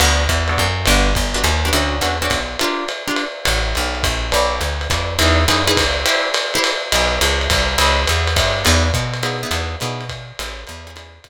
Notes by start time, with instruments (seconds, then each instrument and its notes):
0.00 electric bass (finger) D2, acoustic guitar (steel) B3 D4 F#4 A4, crash, ride
0.29 electric bass (finger) E2, kick, hi-hat pedal, ride
0.48 acoustic guitar (steel) B3 D4 F#4 A4, ride
0.57 electric bass (finger) F#2, kick, ride
0.86 electric bass (finger) G1, acoustic guitar (steel) B3 D4 F#4 G4, ride
1.15 electric bass (finger) G1, kick, hi-hat pedal, ride
1.34 acoustic guitar (steel) B3 D4 F#4 G4, ride
1.44 electric bass (finger) D#2, ride
1.65 acoustic guitar (steel) B3 D4 F#4 G4
1.73 electric bass (finger) D2, acoustic guitar (steel) C#4 D4 F#4 A4, ride
2.01 electric bass (finger) E2, acoustic guitar (steel) C#4 D4 F#4 A4, hi-hat pedal, ride
2.22 acoustic guitar (steel) C#4 D4 F#4 A4, ride
2.30 electric bass (finger) B1, kick, ride
2.59 acoustic guitar (steel) D4 F4 G4 A#4, ride
2.88 hi-hat pedal, ride
3.08 acoustic guitar (steel) D4 F4 G4 A#4, ride
3.16 ride
3.45 electric bass (finger) A1, acoustic guitar (steel) C#5 F#5 G5 A5, ride
3.75 electric bass (finger) B1, hi-hat pedal, ride
3.95 ride
4.03 electric bass (finger) A#1, kick, ride
4.32 electric bass (finger) B1, acoustic guitar (steel) B4 C#5 D5 A5, ride
4.61 electric bass (finger) D2, hi-hat pedal, ride
4.81 ride
4.90 electric bass (finger) F2, acoustic guitar (steel) B4 C#5 D5 A5, kick, ride
5.19 electric bass (finger) E2, acoustic guitar (steel) D#4 E4 G#4 B4, ride
5.48 electric bass (finger) F#2, acoustic guitar (steel) D#4 E4 G#4 B4, hi-hat pedal, ride
5.67 acoustic guitar (steel) D#4 E4 G#4 B4, ride
5.77 electric bass (finger) C#2, kick, ride
6.06 acoustic guitar (steel) E4 G4 A4 C5, ride
6.34 hi-hat pedal, ride
6.54 acoustic guitar (steel) E4 G4 A4 C5, ride
6.64 ride
6.92 electric bass (finger) B1, acoustic guitar (steel) D#5 G#5 A5 B5, ride
7.21 electric bass (finger) C#2, hi-hat pedal, ride
7.41 ride
7.50 electric bass (finger) C2, kick, ride
7.78 electric bass (finger) C#2, acoustic guitar (steel) C#5 D#5 E5 B5, ride
8.07 electric bass (finger) E2, hi-hat pedal, ride
8.27 ride
8.36 electric bass (finger) G2, acoustic guitar (steel) C#5 D#5 E5 B5, kick, ride
8.65 electric bass (finger) E2, acoustic guitar (steel) B3 D#4 E4 G#4, crash, ride
8.94 electric bass (finger) B2, kick, hi-hat pedal, ride
9.14 ride
9.23 acoustic guitar (steel) B3 D#4 E4 G#4, ride
9.43 acoustic guitar (steel) B3 D#4 E4 G#4
9.51 electric bass (finger) E2, ride
9.80 electric bass (finger) B2, acoustic guitar (steel) B3 D#4 E4 G#4, hi-hat pedal, ride
10.01 ride
10.09 kick, ride
10.39 electric bass (finger) A1, acoustic guitar (steel) C#4 E4 G#4 A4, ride
10.67 electric bass (finger) E2, hi-hat pedal, ride
10.87 acoustic guitar (steel) C#4 E4 G#4 A4, ride
10.96 acoustic guitar (steel) C#4 E4 G#4 A4, ride
11.24 acoustic guitar (steel) B3 D#4 E4 G#4, kick, ride